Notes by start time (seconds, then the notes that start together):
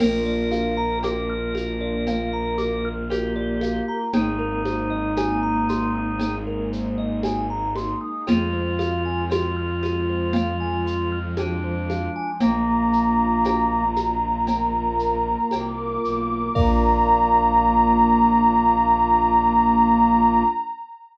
0.00 A#1 A#3 D4 F4 A#4, crash, cowbell, low conga, shaker
0.26 D5
0.52 F5, high conga, shaker
0.77 A#5
1.03 A#4 D6, cowbell, high conga, shaker
1.30 F6
1.55 A#4, high conga, shaker
1.81 D5
2.05 A#3 F4 A#4 F5, cowbell, low conga, shaker
2.33 A#5
2.58 D6, high conga, shaker
2.85 F6
3.10 G4 A#4, cowbell, high conga, shaker
3.36 D5
3.61 F5, high conga, shaker
3.88 A#5
4.13 G#1 G#3 A#3 C4 D#4 G#4, cowbell, low conga, shaker
4.39 A#4
4.65 C5, high conga, shaker
4.90 D#5
5.16 G#5, cowbell, high conga, shaker
5.43 A#5
5.69 C6, high conga, shaker
5.95 D#6
6.19 G#3 A#3 D#4 G#4, cowbell, low conga, shaker
6.47 A#4
6.73 C5, shaker
6.98 D#5
7.23 G#5, cowbell, high conga, shaker
7.50 A#5
7.75 C6, high conga, shaker
8.01 D#6
8.27 F2 G#3 C4 F4 G#4, cowbell, low conga, shaker
8.53 C5
8.79 F5, high conga, shaker
9.05 G#5
9.30 F4 C6, cowbell, high conga, shaker
9.56 F6
9.83 G#4, high conga, shaker
10.10 C5
10.33 F3 G#3 F4 F5, cowbell, low conga, shaker
10.60 G#5
10.86 C6, shaker
11.12 F6
11.37 D4 G#4, cowbell, high conga, shaker
11.64 C5
11.90 F5, high conga, shaker
12.16 G#5
12.40 A#1 A#3 D4 F4 A#5, cowbell, low conga, shaker
12.93 shaker
13.44 cowbell, high conga, shaker
13.96 high conga, shaker
14.47 A#3 F4 A#4, cowbell, low conga, shaker
14.99 shaker
15.51 C2 D6, cowbell, high conga, shaker
16.03 B1, shaker
16.54 A#1 A#3 D4 F4 A#4 D5 F5 A#5, kick, crash